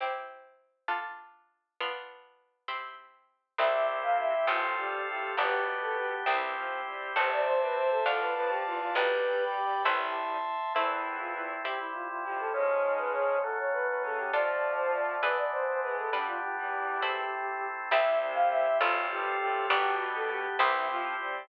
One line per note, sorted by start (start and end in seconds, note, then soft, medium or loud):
0.00 0.88 C4 medium
0.00 0.88 E4 medium
0.00 0.88 G4 medium
0.88 1.76 D4 medium
0.88 1.76 F4 medium
0.88 1.76 A4 medium
1.80 2.68 B3 medium
1.80 2.68 D4 medium
1.80 2.68 F4 medium
2.68 3.56 C4 medium
2.68 3.56 E4 medium
2.68 3.56 G4 medium
3.58 4.41 C2 medium
3.58 4.34 C2 loud
3.58 4.34 C3 loud
3.58 4.47 C4 medium
3.58 4.48 E4 medium
3.58 4.47 E4 medium
3.58 4.48 G4 medium
3.58 4.47 G4 medium
3.58 3.86 E5 loud
4.03 4.17 F5 medium
4.19 4.46 E5 loud
4.47 5.30 A1 medium
4.47 4.74 F2 medium
4.47 4.74 F3 loud
4.47 5.35 C4 medium
4.47 5.36 C4 medium
4.47 5.35 F4 medium
4.47 5.36 F4 medium
4.47 4.76 F4 medium
4.47 5.35 A4 medium
4.47 5.36 A4 medium
4.77 5.01 G2 medium
4.77 5.01 G3 loud
4.77 5.07 G4 loud
5.07 5.33 A2 medium
5.07 5.33 A3 loud
5.07 5.35 G4 loud
5.37 6.20 G1 medium
5.37 6.14 B2 loud
5.37 6.26 B3 medium
5.37 6.14 B3 loud
5.37 6.26 B3 medium
5.37 6.26 D4 medium
5.37 6.26 G4 medium
5.37 5.63 G4 loud
5.37 6.26 G4 medium
5.82 5.96 A4 medium
5.97 6.23 G4 medium
6.26 7.09 C2 medium
6.26 6.54 E3 medium
6.26 7.14 C4 medium
6.26 7.15 C4 medium
6.26 6.55 C4 medium
6.26 7.14 E4 medium
6.26 6.54 E4 loud
6.26 7.15 E4 medium
6.26 7.14 G4 medium
6.26 7.15 G4 medium
6.55 6.81 F3 loud
6.55 6.84 C4 medium
6.55 6.81 F4 loud
6.86 7.12 G3 medium
6.86 7.12 C4 medium
6.86 7.12 G4 medium
7.15 7.99 A1 medium
7.15 8.02 C3 loud
7.15 8.02 C4 loud
7.15 8.04 C4 medium
7.15 8.04 E4 medium
7.15 8.04 A4 medium
7.15 7.29 C5 loud
7.15 8.05 C5 medium
7.15 8.05 E5 medium
7.15 8.05 A5 medium
7.33 7.47 D5 loud
7.47 7.61 C5 loud
7.62 7.76 B4 medium
7.76 7.90 C5 medium
7.91 8.05 A4 loud
8.06 8.88 D2 medium
8.06 8.34 F2 medium
8.06 8.34 F3 medium
8.06 8.94 D4 medium
8.06 8.94 F4 medium
8.06 8.94 A4 medium
8.06 8.20 A4 loud
8.06 8.94 D5 medium
8.06 8.94 F5 medium
8.06 8.94 A5 medium
8.20 8.34 B4 medium
8.36 8.63 F2 loud
8.36 8.63 F3 loud
8.36 8.50 B4 loud
8.49 8.64 G4 loud
8.65 8.94 E2 loud
8.65 8.94 E3 loud
8.65 8.80 F4 loud
8.80 8.95 F4 loud
8.94 9.78 B1 medium
8.94 10.37 G2 medium
8.94 10.37 G3 loud
8.94 9.84 D4 medium
8.94 9.44 G4 loud
8.94 9.84 G4 medium
8.94 9.44 B4 loud
8.94 9.84 B4 medium
8.94 9.83 D5 medium
8.94 9.83 G5 medium
8.94 9.83 B5 medium
9.55 9.82 G4 medium
9.84 10.68 A1 medium
9.84 10.38 E4 loud
9.84 10.73 E4 medium
9.84 10.73 A4 medium
9.84 10.73 C5 medium
9.84 10.73 E5 medium
9.84 10.73 A5 medium
9.84 10.73 C6 medium
10.75 11.53 E2 loud
10.75 11.53 E3 loud
10.75 11.63 A3 medium
10.75 11.63 C4 medium
10.75 11.63 E4 loud
10.75 11.17 E4 loud
10.75 11.63 E4 medium
11.19 11.33 F4 loud
11.35 11.60 E4 loud
11.64 12.53 C3 medium
11.64 12.53 G3 medium
11.64 12.53 C4 medium
11.64 12.53 E4 medium
11.64 11.78 G4 medium
11.64 12.53 G4 medium
11.79 11.93 E4 loud
11.93 12.07 F4 medium
12.09 12.24 F4 medium
12.24 12.49 F2 medium
12.24 12.49 F3 medium
12.24 12.38 G4 loud
12.40 12.54 A4 loud
12.53 13.37 G#2 loud
12.53 13.42 F3 medium
12.53 13.42 G#3 medium
12.53 13.37 G#3 loud
12.53 13.42 C#4 medium
12.53 12.94 C#5 loud
12.98 13.12 B4 medium
13.13 13.40 C#5 loud
13.43 14.32 F#3 medium
13.43 14.32 A3 medium
13.43 14.32 C#4 medium
13.43 13.57 A4 loud
13.58 13.73 C#5 medium
13.73 13.87 B4 loud
13.88 14.02 B4 loud
14.02 14.30 C#3 medium
14.02 14.30 C#4 loud
14.02 14.19 A4 medium
14.17 14.31 G4 medium
14.32 15.22 D3 medium
14.32 15.16 F3 loud
14.32 15.22 F3 medium
14.32 15.22 A3 medium
14.32 15.21 D4 medium
14.32 15.16 F4 loud
14.32 15.21 F4 medium
14.32 15.21 A4 medium
14.32 14.74 D5 loud
14.77 14.91 C5 loud
14.94 15.22 D5 medium
15.22 16.11 E3 loud
15.22 16.11 E3 medium
15.22 16.11 G#3 medium
15.22 16.11 B3 medium
15.22 16.11 D4 loud
15.22 16.11 D4 medium
15.22 16.11 G#4 medium
15.22 15.36 B4 medium
15.22 16.11 B4 medium
15.37 15.51 D5 medium
15.52 15.66 C5 medium
15.66 15.80 C5 loud
15.81 16.09 G#3 medium
15.81 16.09 G#4 loud
15.81 15.96 B4 medium
15.99 16.13 A4 medium
16.12 16.37 G2 medium
16.12 16.37 G3 loud
16.12 17.01 G3 medium
16.12 17.01 B3 medium
16.12 17.01 D4 medium
16.12 16.27 D4 loud
16.12 17.01 D4 medium
16.12 17.01 B4 medium
16.26 16.41 F4 loud
16.41 16.55 G4 loud
16.56 17.23 E2 medium
16.56 17.23 E3 medium
16.56 17.67 G4 medium
17.01 17.89 A3 medium
17.01 17.90 A3 medium
17.01 17.89 C4 medium
17.01 17.89 E4 medium
17.01 17.90 E4 medium
17.01 17.90 C5 medium
17.91 18.74 C2 medium
17.91 18.67 C2 loud
17.91 18.67 C3 loud
17.91 18.80 C4 loud
17.91 18.80 C4 medium
17.91 18.80 E4 loud
17.91 18.80 E4 medium
17.91 18.80 G4 loud
17.91 18.80 G4 medium
17.91 18.19 E5 loud
18.34 18.49 F5 loud
18.51 18.78 E5 loud
18.80 19.63 A1 loud
18.80 19.07 F2 loud
18.80 19.07 F3 loud
18.80 19.69 C4 loud
18.80 19.68 C4 medium
18.80 19.07 F4 loud
18.80 19.69 F4 loud
18.80 19.68 F4 medium
18.80 19.69 A4 loud
18.80 19.68 A4 medium
19.10 19.35 G2 loud
19.10 19.35 G3 loud
19.10 19.39 G4 loud
19.39 19.66 A2 loud
19.39 19.66 A3 loud
19.39 19.66 G4 loud
19.69 20.52 G1 medium
19.69 20.46 B2 loud
19.69 20.58 B3 loud
19.69 20.58 B3 medium
19.69 20.46 B3 loud
19.69 20.58 D4 loud
19.69 20.58 D4 medium
19.69 19.94 G4 loud
19.69 20.58 G4 loud
19.69 20.58 G4 medium
20.15 20.29 A4 loud
20.30 20.56 G4 loud
20.59 21.42 C2 loud
20.59 20.87 E3 loud
20.59 21.48 C4 loud
20.59 21.47 C4 medium
20.59 20.88 C4 loud
20.59 21.48 E4 medium
20.59 20.87 E4 loud
20.59 21.47 E4 medium
20.59 21.48 G4 loud
20.59 21.47 G4 medium
20.89 21.16 F3 loud
20.89 21.14 C4 loud
20.89 21.16 F4 loud
21.19 21.45 G3 loud
21.19 21.46 C4 loud
21.19 21.45 G4 loud